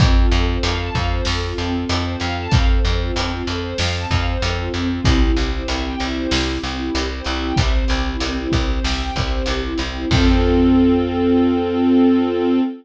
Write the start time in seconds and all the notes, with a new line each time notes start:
0.00 F2 C4 F4 A4, kick, closed hi-hat
0.16 F4
0.31 F2 A4, closed hi-hat
0.47 C5
0.63 F2 F5, closed hi-hat
0.79 A5
0.94 F2 F5, kick, closed hi-hat
1.11 C5
1.25 F2 A4, snare
1.43 F4
1.58 F2 C4, closed hi-hat
1.74 F4
1.89 F2 A4, closed hi-hat
2.05 C5
2.20 F2 F5, closed hi-hat
2.38 A5
2.51 F2 C4 A4 C5 F5, kick, closed hi-hat
2.68 C5
2.83 F2 A4, closed hi-hat
3.00 F4
3.16 F2 C4, closed hi-hat
3.32 F4
3.46 F2 A4, closed hi-hat
3.62 C5
3.78 F2 F5, snare
3.93 A5
4.10 F2 F5, kick, closed hi-hat
4.27 C5
4.42 F2 A4, closed hi-hat
4.58 F4
4.74 F2 C4, closed hi-hat
4.90 F4
5.04 C2 C4 E4 G4, kick, closed hi-hat
5.21 E4
5.36 C2 G4, closed hi-hat
5.52 C5
5.68 C2 E5, closed hi-hat
5.85 G5
6.00 C2 E5, closed hi-hat
6.16 C5
6.31 C2 G4, snare
6.49 E4
6.63 C2 C4, closed hi-hat
6.79 E4
6.94 C2 G4, closed hi-hat
7.09 C5
7.24 C2 E5, closed hi-hat
7.43 G5
7.56 C2 C4 G4 C5 E5, kick, closed hi-hat
7.74 C5
7.88 C2 G4, closed hi-hat
8.06 E4
8.20 C2 C4, closed hi-hat
8.37 E4
8.52 C2 G4, kick, closed hi-hat
8.69 C5
8.84 C2 E5, snare
9.00 G5
9.15 C2 E5, kick, closed hi-hat
9.33 C5
9.46 C2 G4, closed hi-hat
9.64 E4
9.78 C2 C4, closed hi-hat
9.95 E4
10.10 F2 C4 F4 A4, kick, crash